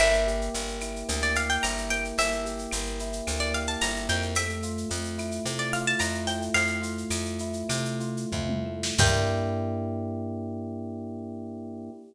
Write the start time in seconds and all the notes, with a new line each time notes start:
0.00 G1 A#3 E5, crash, cowbell, claves
0.13 shaker
0.27 G4, shaker
0.41 shaker
0.54 G1 A#3, tambourine, shaker
0.68 shaker
0.81 E4, claves, shaker
0.96 shaker
1.09 D2 A#3, cowbell, shaker
1.23 D5, shaker
1.35 G4 F5, shaker
1.50 G5, shaker
1.62 G1 E4 A#5, tambourine, cowbell, claves, shaker
1.78 shaker
1.90 A#3 G5, cowbell, shaker
2.05 shaker
2.18 G1 A#3 E5, cowbell, shaker
2.33 shaker
2.45 G4, shaker
2.59 shaker
2.71 G1 A#3, tambourine, claves, shaker
2.86 shaker
2.99 E4, shaker
3.13 shaker
3.27 D2 A#3, cowbell, claves, shaker
3.40 D5, shaker
3.54 G4 F5, shaker
3.67 A5, shaker
3.81 G1 E4 A#5, tambourine, cowbell, shaker
3.96 shaker
4.08 F2 A#3 G5, cowbell, shaker
4.22 shaker
4.35 A3 E5, cowbell, claves, shaker
4.50 shaker
4.63 F4, shaker
4.78 shaker
4.89 F2 A3, tambourine, shaker
5.04 shaker
5.18 E4, claves, shaker
5.31 shaker
5.45 C3 A3, cowbell, shaker
5.58 D5, shaker
5.73 F4 F5, shaker
5.87 A5, shaker
5.99 F2 E4 A#5, tambourine, cowbell, claves, shaker
6.15 shaker
6.27 A3 G5, cowbell, shaker
6.42 shaker
6.54 F2 A3 F5, cowbell, shaker
6.67 shaker
6.81 F4, shaker
6.98 shaker
7.10 F2 A3, tambourine, claves, shaker
7.25 shaker
7.39 E4, shaker
7.53 shaker
7.69 C3 A3, cowbell, claves, shaker
7.85 shaker
8.00 F4, shaker
8.17 shaker
8.32 F2 E4, kick, floor tom
8.49 mid tom
8.66 A3
8.83 snare
8.98 G2 A#3 D4 E4 G4 G5, kick, crash